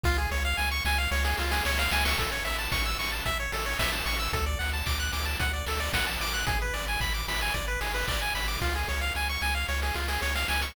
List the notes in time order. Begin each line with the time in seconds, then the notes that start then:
0.03 C#2 F4, kick, snare
0.18 G#4
0.31 C#2 C#5, snare
0.45 F5
0.57 C#2 G#5, snare
0.71 C#6
0.85 C#2 G#5, snare
0.98 F5
1.11 C#2 C#5, snare
1.24 G#4, snare
1.38 C#2 F4, snare
1.51 G#4, snare
1.65 C#2 C#5, snare
1.78 F5, snare
1.91 C#2 G#5, snare
2.05 C#6, snare
2.18 A1 A4, kick, closed hi-hat
2.32 C#5
2.45 A1 E5, open hi-hat
2.58 A5
2.72 A1 C#6, kick, snare
2.85 E6
2.99 A1 C#6, open hi-hat
3.12 A5
3.25 A1 E5, kick, closed hi-hat
3.40 C#5
3.52 A1 A4, open hi-hat
3.66 C#5
3.79 A1 E5, kick, snare
3.93 A5
4.06 A1 C#6, open hi-hat
4.19 E6
4.33 D2 A4, kick, closed hi-hat
4.46 D5
4.59 D2 F#5, open hi-hat
4.73 A5
4.86 D2 D6, kick, clap
5.00 F#6
5.12 D2 D6, open hi-hat
5.25 A5
5.40 D2 F#5, kick, closed hi-hat
5.53 D5
5.66 D2 A4, open hi-hat
5.80 D5
5.93 A#1 F#5, kick, snare
6.07 A5
6.20 A1 D6, open hi-hat
6.34 F#6
6.47 G#1 G#4, kick, closed hi-hat
6.62 B4
6.74 G#1 D5, open hi-hat
6.88 G#5
7.00 G#1 B5, kick, clap
7.14 D6
7.27 G#1 B5, open hi-hat
7.41 G#5
7.54 G#1 D5, kick, closed hi-hat
7.68 B4
7.81 G#1 G#4, open hi-hat
7.94 B4
8.07 G#1 D5, kick, clap
8.22 G#5
8.35 G#1 B5, open hi-hat
8.48 D6
8.61 C#2 F4, kick, snare
8.75 G#4
8.88 C#2 C#5, snare
9.01 F5
9.15 C#2 G#5, snare
9.29 C#6
9.42 C#2 G#5, snare
9.55 F5
9.68 C#2 C#5, snare
9.82 G#4, snare
9.94 C#2 F4, snare
10.08 G#4, snare
10.22 C#2 C#5, snare
10.35 F5, snare
10.48 C#2 G#5, snare
10.61 C#6, snare